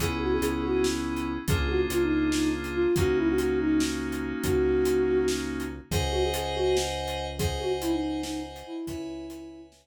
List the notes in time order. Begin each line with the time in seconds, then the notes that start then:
0.00 C#2 B3 C#4 E4 G#4, kick, closed hi-hat
0.21 F#4
0.32 G#4
0.41 C#2 G#4, closed hi-hat
0.64 F#4
0.84 snare
1.16 closed hi-hat
1.48 C#2 A#3 D4 F4 G#4, kick, closed hi-hat
1.69 F#4
1.90 C#2 F4, closed hi-hat
2.02 D#4
2.31 D#4, snare
2.64 closed hi-hat
2.74 F4
2.96 C#2 A#3 C#4 D#4 F#4, kick, closed hi-hat
3.17 E4
3.28 F#4
3.38 F#4, closed hi-hat
3.61 D#4
3.80 snare
4.12 closed hi-hat
4.44 C#2 F#4, kick, closed hi-hat
4.85 closed hi-hat
5.28 snare
5.60 closed hi-hat
5.91 C#2 G#4 C5 D#5 F#5 G#5, kick, closed hi-hat
6.11 F#4
6.24 G#4
6.34 G#4, closed hi-hat
6.55 F#4
6.77 snare
7.08 closed hi-hat
7.38 G#4 C5 D#5 F#5 G#5, kick, closed hi-hat
7.60 F#4
7.81 E4, closed hi-hat
7.92 D#4
8.22 D#4, snare
8.56 closed hi-hat
8.66 E4
8.87 C#2 E4 B4 C#5 E5 G#5, kick, closed hi-hat
9.30 B4 C#5 E5 G#5, closed hi-hat
9.72 snare